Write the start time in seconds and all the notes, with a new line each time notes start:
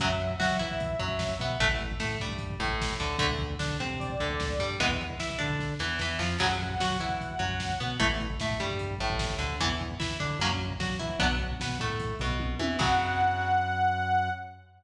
0.00 F#2 C#3 F#3 E5, kick, closed hi-hat
0.09 kick
0.20 kick, closed hi-hat
0.30 kick
0.40 F#3 F#4, kick, snare
0.51 kick
0.59 E3 E4, kick, closed hi-hat
0.71 kick
0.80 kick, closed hi-hat
0.90 kick
0.99 F#2 F#3, kick, closed hi-hat
1.08 kick
1.19 kick, snare
1.29 kick
1.39 B2 B3, kick, closed hi-hat
1.50 kick
1.60 A1 E3 A3, kick, closed hi-hat
1.69 kick
1.78 kick, closed hi-hat
1.92 kick
2.00 A2 A3, kick, snare
2.11 kick
2.19 G2 G3, kick, closed hi-hat
2.29 kick
2.38 kick, closed hi-hat
2.50 kick
2.59 A1 A2, kick, closed hi-hat
2.68 kick
2.81 kick, snare
2.90 kick
2.99 D2 D3, kick, closed hi-hat
3.09 kick
3.19 D2 D3 A3, kick, closed hi-hat
3.29 kick
3.39 kick, closed hi-hat
3.50 kick
3.59 D3 D4, kick, snare
3.68 kick
3.80 C3 C4, kick, closed hi-hat
3.91 kick
3.99 D5, kick, closed hi-hat
4.10 kick
4.20 D2 D3, kick, closed hi-hat
4.30 kick
4.40 kick, snare
4.50 kick
4.59 G2 G3, kick, closed hi-hat
4.71 kick
4.80 E2 E3 G#3 B3, kick, closed hi-hat
4.91 kick
4.99 kick, closed hi-hat
5.10 kick
5.19 E3 E4, kick, snare
5.30 kick
5.39 D3 D4, kick, closed hi-hat
5.50 kick
5.60 kick, snare
5.79 E2 E3, snare
5.99 E2 E3, snare
6.19 F2 F3, snare
6.39 F#2 C#3 F#3 F#5, kick, crash
6.49 kick
6.60 kick, closed hi-hat
6.70 kick
6.80 F#3 F#4, kick, snare
6.91 kick
7.00 E3 E4, kick, closed hi-hat
7.09 kick
7.21 kick, closed hi-hat
7.31 kick
7.39 F#2 F#3, kick, closed hi-hat
7.50 kick
7.60 kick, snare
7.70 kick
7.79 B2 B3, kick, closed hi-hat
7.88 kick
8.00 A1 E3 A3, kick, closed hi-hat
8.10 kick
8.20 kick, closed hi-hat
8.30 kick
8.40 A2 A3, kick, snare
8.51 kick
8.60 G2 G3, kick, closed hi-hat
8.71 kick
8.79 kick, closed hi-hat
8.91 kick
8.99 A1 A2, kick, closed hi-hat
9.10 kick
9.19 kick, snare
9.30 kick
9.39 D2 D3, kick, closed hi-hat
9.49 kick
9.60 E2 E3 B3, kick, closed hi-hat
9.69 kick
9.80 kick, closed hi-hat
9.91 kick
10.00 E3 E4, kick, snare
10.11 kick
10.20 D3 D4, kick, closed hi-hat
10.31 kick
10.39 F#2 F#3 A#3 C#4, kick, closed hi-hat
10.51 kick
10.59 kick, closed hi-hat
10.70 kick
10.80 F#3 F#4, kick, snare
10.90 kick
10.99 E3 E4, kick, closed hi-hat
11.10 kick
11.19 B1 F#3 B3 D4, kick, closed hi-hat
11.31 kick
11.39 kick, closed hi-hat
11.51 kick
11.60 B2 B3, kick, snare
11.69 kick
11.78 A2 A3, kick, closed hi-hat
11.90 kick
12.00 kick, closed hi-hat
12.10 kick
12.19 B1 B2, kick, closed hi-hat
12.29 kick
12.39 kick, high tom
12.59 E2 E3, high tom
12.79 F#2 C#3 F#3 F#5, kick, crash